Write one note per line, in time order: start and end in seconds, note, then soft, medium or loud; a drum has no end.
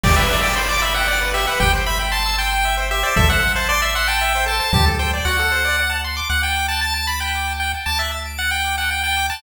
0.03 1.47 G1 loud
0.03 0.15 G4 loud
0.03 0.16 D5 medium
0.03 kick loud
0.03 crash loud
0.16 0.28 B4 loud
0.16 0.41 E5 medium
0.29 0.40 D5 loud
0.43 0.55 D5 medium
0.43 0.55 G5 loud
0.56 0.68 C5 medium
0.56 0.68 B5 loud
0.69 0.81 D5 medium
0.69 0.81 D6 loud
0.81 0.94 E5 medium
0.81 0.93 B5 loud
0.94 1.30 F#5 medium
0.94 1.07 G5 loud
1.07 1.19 D5 loud
1.20 1.32 B4 loud
1.34 1.45 G4 loud
1.34 1.46 E5 medium
1.47 1.59 B4 loud
1.47 1.59 F#5 medium
1.59 3.04 G1 loud
1.59 1.71 G4 loud
1.59 1.72 G5 medium
1.59 kick medium
1.73 1.85 C5 loud
1.86 1.98 E5 loud
1.86 1.99 B5 medium
1.99 2.11 G5 loud
2.11 2.36 A5 medium
2.11 2.23 C6 loud
2.25 2.37 E6 loud
2.38 2.75 G5 medium
2.38 2.50 C6 loud
2.53 2.64 G5 loud
2.65 2.76 E5 loud
2.77 2.89 C5 loud
2.91 3.02 G4 loud
2.91 3.03 E5 medium
3.03 3.14 C5 loud
3.03 3.16 D5 medium
3.16 4.61 A1 loud
3.16 3.28 A4 loud
3.16 3.29 E5 medium
3.16 kick loud
3.28 3.40 C5 loud
3.28 3.52 F#5 medium
3.43 3.54 E5 loud
3.55 3.68 C5 medium
3.55 3.68 A5 loud
3.69 3.81 D5 medium
3.69 3.81 C6 loud
3.81 3.94 E5 medium
3.81 3.93 E6 loud
3.95 4.07 F#5 medium
3.95 4.07 C6 loud
4.07 4.45 G5 medium
4.07 4.19 A5 loud
4.21 4.33 E5 loud
4.35 4.47 C5 loud
4.46 4.57 A4 loud
4.46 4.59 A5 medium
4.59 4.71 C5 medium
4.59 4.72 A5 medium
4.73 5.21 D2 loud
4.73 4.85 G4 loud
4.73 4.85 A5 medium
4.73 kick loud
4.86 4.98 A4 loud
4.99 5.11 C5 loud
4.99 5.12 G5 medium
5.13 5.25 D5 loud
5.25 6.21 D2 loud
5.25 5.37 F#4 loud
5.25 5.92 F#5 medium
5.39 5.50 A4 loud
5.51 5.63 C5 loud
5.64 5.76 D5 loud
5.79 5.90 F#5 loud
5.89 6.01 A5 loud
6.04 6.16 C6 loud
6.16 6.28 D6 loud
6.29 7.74 D2 loud
6.29 6.41 F#5 medium
6.29 6.42 F#5 medium
6.43 6.67 G5 medium
6.43 6.55 A5 medium
6.56 6.67 D6 medium
6.68 6.81 A5 medium
6.68 6.80 F#6 medium
6.81 6.94 A5 medium
6.81 6.95 A6 medium
6.94 7.07 A5 medium
6.94 7.07 D7 medium
7.07 7.20 B5 medium
7.07 7.20 A6 medium
7.20 7.53 G5 medium
7.20 7.31 F#6 medium
7.35 7.47 D6 medium
7.47 7.59 A5 medium
7.60 7.71 F#5 medium
7.60 7.72 G5 medium
7.74 7.86 A5 medium
7.86 9.30 D2 medium
7.86 7.98 A5 medium
7.86 7.98 D6 medium
7.99 8.11 E5 medium
7.99 8.11 F#6 medium
8.11 8.23 A6 medium
8.25 8.37 D7 medium
8.38 8.51 F#5 medium
8.38 8.49 A6 medium
8.51 8.76 G5 medium
8.51 8.63 F#6 medium
8.64 8.76 D6 medium
8.77 8.90 F#5 medium
8.77 8.89 A5 medium
8.90 9.02 F#5 medium
8.90 9.03 G5 medium
9.03 9.27 G5 medium
9.03 9.15 A5 medium
9.17 9.28 D6 medium
9.30 9.42 A5 medium
9.30 9.41 F#6 medium